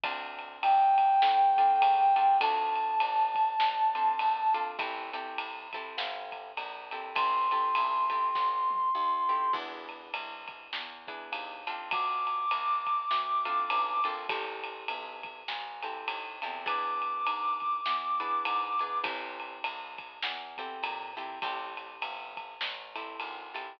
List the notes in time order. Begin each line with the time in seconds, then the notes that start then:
0.04 D2 C4 D4 F4 A4, kick, ride
0.39 ride
0.62 F2 G5, ride
0.98 kick, ride
1.22 A2, snare
1.57 C4 D4 F4 A4, kick, ride
1.82 C#3, ride
2.16 C4 D4 F4 A4, ride
2.41 D2 C4 D4 F4 A4 A5, kick, ride
2.76 ride
3.00 A1, ride
3.35 kick, ride
3.60 A1, snare
3.95 C4 D4 F4 A4, ride
4.19 A#1, ride
4.54 C4 D4 F4 A4, ride
4.79 A1 C4 E4 G4 A4, kick, ride
5.13 C4 E4 G4 A4, ride
5.38 C2, ride
5.73 C4 E4 G4 A4, kick, ride
5.98 G1, snare
6.32 kick, ride
6.57 A#1, ride
6.91 C4 E4 G4 A4, ride
7.15 A1 C4 E4 G4 A4 C6, kick, ride
7.51 C4 E4 G4 A4, ride
7.75 B1, ride
8.10 C4 E4 G4 A4, kick, ride
8.35 A1, kick, snare
8.71 high tom
8.95 D#2
9.29 C4 E4 G4 A4
9.53 E2 B3 D4 E4 G#4, kick, crash
9.89 ride
10.13 C2, ride
10.48 kick, ride
10.73 E2, snare
11.07 B3 D4 E4 G#4, kick, ride
11.32 D#2, ride
11.67 C4 D4 F4 A4, ride
11.91 D2 D6, kick, ride
12.27 ride
12.51 C2, ride
12.87 kick, ride
13.11 D2, snare
13.45 C4 D4 F4 A4, ride
13.70 B1, ride
14.04 A#1 C4 D4 F4 A4, ride
14.29 A1 C4 E4 G4 A4, kick, ride
14.64 ride
14.88 B1, ride
15.23 kick, ride
15.48 A1, snare
15.83 C4 E4 G4 A4, ride
16.08 D#2, ride
16.42 E2 C4 E4 G4 A4, ride
16.66 B3 D4 E4 G#4 D6, kick, ride
17.02 ride
17.26 G#2, ride
17.60 kick, ride
17.86 E2, snare
18.20 B3 D4 E4 G#4, ride
18.45 G#2, ride
18.79 B3 D4 E4 G#4, ride
19.04 A1 C4 E4 G4 A4, kick, ride
19.40 ride
19.64 C2, ride
19.98 kick, ride
20.23 E2, snare
20.58 C4 E4 G4 A4, kick, ride
20.83 A#2, ride
21.17 C4 E4 G4 A4, ride
21.42 A1 C4 E4 G4 A4, kick, ride
21.77 ride
22.02 G1, ride
22.37 kick, ride
22.61 A1, snare
22.96 C4 E4 G4 A4, ride
23.20 G#1, ride
23.54 C4 E4 G4 A4, ride